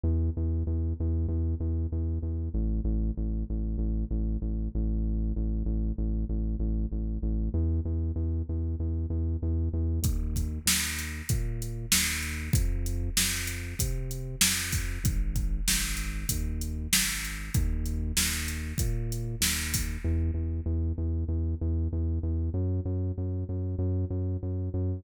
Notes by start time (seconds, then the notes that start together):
0.04 E2
0.37 E2
0.67 E2
1.00 E2
1.28 E2
1.60 E2
1.92 E2
2.22 E2
2.54 A1
2.84 A1
3.17 A1
3.50 A1
3.78 A1
4.11 A1
4.42 A1
4.75 A1
5.36 A1
5.65 A1
5.98 A1
6.29 A1
6.59 A1
6.92 A1
7.22 A1
7.54 E2
7.85 E2
8.16 E2
8.49 E2
8.80 E2
9.10 E2
9.42 E2
9.73 E2
10.02 D#2, kick, closed hi-hat
10.36 kick, closed hi-hat
10.66 D#2, snare
10.99 closed hi-hat
11.29 A#2, kick, closed hi-hat
11.62 closed hi-hat
11.92 D#2, snare
12.23 closed hi-hat
12.53 F2, kick, closed hi-hat
12.86 closed hi-hat
13.17 F2, snare
13.47 closed hi-hat
13.79 C3, kick, closed hi-hat
14.11 closed hi-hat
14.41 F2, snare
14.72 kick, open hi-hat
15.04 G#1, kick, closed hi-hat
15.36 kick, closed hi-hat
15.68 G#1, snare
15.97 closed hi-hat
16.29 D#2, kick, closed hi-hat
16.61 closed hi-hat
16.93 G#1, snare
17.25 closed hi-hat
17.54 D#2, kick, closed hi-hat
17.86 closed hi-hat
18.17 D#2, snare
18.48 closed hi-hat
18.78 A#2, kick, closed hi-hat
19.12 closed hi-hat
19.41 D#2, snare
19.74 kick, open hi-hat
20.04 E2
20.34 E2
20.66 E2
20.98 E2
21.28 E2
21.61 E2
21.92 E2
22.23 E2
22.54 F#2
22.85 F#2
23.18 F#2
23.49 F#2
23.79 F#2
24.10 F#2
24.43 F#2
24.74 F#2